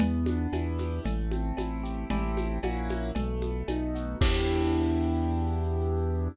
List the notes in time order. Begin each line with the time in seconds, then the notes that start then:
0.00 E2 B3, cowbell, low conga, shaker
0.26 D4, high conga, shaker
0.53 E2 E4, tambourine, cowbell, high conga, shaker
0.78 G4, high conga, shaker
1.04 A1 A3, cowbell, low conga, shaker
1.31 C4, high conga, shaker
1.57 A1 E4, tambourine, cowbell, high conga, shaker
1.83 G4, shaker
2.10 A1 A3 C4 E4 G4, cowbell, low conga, shaker
2.37 high conga, shaker
2.63 A#1 A#3 C#4 E4 F#4, tambourine, cowbell, high conga, shaker
2.89 high conga, shaker
3.15 B1 A3, cowbell, low conga, shaker
3.42 B3, high conga, shaker
3.68 B1 D#4, tambourine, cowbell, high conga, shaker
3.95 F#4, shaker
4.21 E2 B3 D4 E4 G4, kick, crash